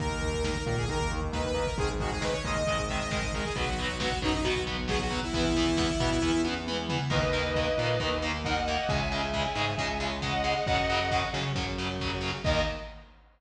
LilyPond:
<<
  \new Staff \with { instrumentName = "Lead 2 (sawtooth)" } { \time 4/4 \key dis \phrygian \tempo 4 = 135 ais'4 ais'8 ais'16 gis'16 ais'8 r8 b'16 b'8 ais'16 | gis'16 r16 fis'16 gis'16 b'16 cis''16 dis''4 e''16 dis''16 dis''8 ais'16 gis'16 | fis'4 fis'8 dis'16 dis'16 fis'8 r8 gis'16 fis'8 e'16 | e'2. r4 |
r1 | r1 | r1 | r1 | }
  \new Staff \with { instrumentName = "Distortion Guitar" } { \time 4/4 \key dis \phrygian r1 | r1 | r1 | r1 |
<b' dis''>2. <dis'' fis''>4 | <e'' gis''>2. <dis'' fis''>4 | <dis'' fis''>4. r2 r8 | dis''4 r2. | }
  \new Staff \with { instrumentName = "Overdriven Guitar" } { \time 4/4 \key dis \phrygian <dis ais>8 <dis ais>8 <dis ais>8 <dis ais>8 <dis ais>8 <dis ais>8 <dis ais>8 <dis ais>8 | <dis gis>8 <dis gis>8 <dis gis>8 <dis gis>8 <dis gis>8 <dis gis>8 <dis gis>8 <dis gis>8 | <fis b>8 <fis b>8 <fis b>8 <fis b>8 <fis b>8 <fis b>8 <fis b>8 <fis b>8 | <e b>8 <e b>8 <e b>8 <e b>8 <e b>8 <e b>8 <e b>8 <e b>8 |
<dis ais>8 <dis ais>8 <dis ais>8 <dis ais>8 <dis ais>8 <dis ais>8 <dis ais>8 <dis ais>8 | <cis gis>8 <cis gis>8 <cis gis>8 <cis gis>8 <cis gis>8 <cis gis>8 <cis gis>8 <cis gis>8 | <cis fis>8 <cis fis>8 <cis fis>8 <cis fis>8 <cis fis>8 <cis fis>8 <cis fis>8 <cis fis>8 | <dis ais>4 r2. | }
  \new Staff \with { instrumentName = "Synth Bass 1" } { \clef bass \time 4/4 \key dis \phrygian dis,4. ais,8 dis,2 | gis,,4. dis,8 gis,,2 | b,,4. fis,8 b,,2 | e,4. b,8 e,2 |
dis,4. ais,8 dis,2 | cis,4. gis,8 cis,2 | fis,4. cis8 fis,2 | dis,4 r2. | }
  \new DrumStaff \with { instrumentName = "Drums" } \drummode { \time 4/4 <hh bd>16 bd16 <hh bd>16 bd16 <bd sn>16 bd16 <hh bd>16 bd16 <hh bd>16 bd16 <hh bd>16 bd16 <bd sn>16 bd16 <hh bd>16 bd16 | <hh bd>16 bd16 <hh bd>16 bd16 <bd sn>16 bd16 <hh bd>16 bd16 <hh bd>16 bd16 <hh bd>16 bd16 <bd sn>16 bd16 <hh bd>16 bd16 | <hh bd>16 bd16 <hh bd>16 bd16 <bd sn>16 bd16 <hh bd>16 bd16 <hh bd>16 bd16 <hh bd>16 bd16 <bd sn>16 bd16 <hh bd>16 bd16 | <hh bd>16 bd16 <hh bd>16 bd16 <bd sn>16 bd16 <hh bd>16 bd16 bd8 tommh8 toml8 tomfh8 |
<cymc bd>4 bd4 bd4 bd4 | bd4 bd4 bd4 bd4 | bd4 bd4 bd4 bd4 | <cymc bd>4 r4 r4 r4 | }
>>